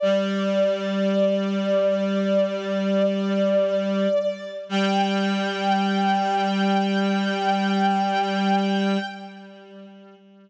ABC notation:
X:1
M:4/4
L:1/8
Q:1/4=51
K:G
V:1 name="Violin"
d8 | g8 |]
V:2 name="Clarinet" clef=bass
G,8 | G,8 |]